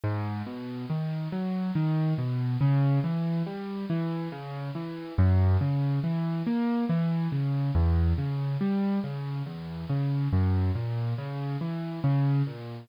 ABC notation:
X:1
M:3/4
L:1/8
Q:1/4=70
K:Bm
V:1 name="Acoustic Grand Piano"
^G,, B,, ^D, F, D, B,, | C, E, G, E, C, E, | F,, C, E, ^A, E, C, | E,, C, G, C, E,, C, |
F,, ^A,, C, E, C, A,, |]